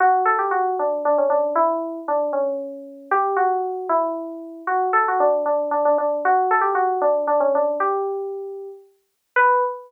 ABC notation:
X:1
M:6/8
L:1/16
Q:3/8=77
K:Bm
V:1 name="Electric Piano 2"
F2 A G F2 D2 D C D2 | E4 D2 C6 | G2 F4 E6 | F2 A F D2 D2 D D D2 |
F2 A G F2 D2 D C D2 | G8 z4 | B6 z6 |]